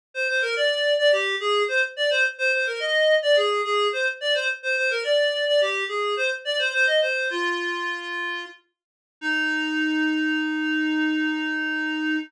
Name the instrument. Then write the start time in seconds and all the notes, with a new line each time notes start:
clarinet
0.14 C5
0.28 C5
0.42 A#4
0.56 D5
0.98 D5
1.12 G4
1.40 G#4
1.68 C5
1.96 D5
2.10 C5
2.38 C5
2.53 C5
2.67 A#4
2.80 D#5
3.22 D5
3.36 G#4
3.64 G#4
3.93 C5
4.21 D5
4.34 C5
4.63 C5
4.77 C5
4.91 A#4
5.04 D5
5.47 D5
5.61 G4
5.88 G#4
6.17 C5
6.45 D5
6.59 C5
6.73 C5
6.87 D#5
7.01 C5
7.30 F4
9.21 D#4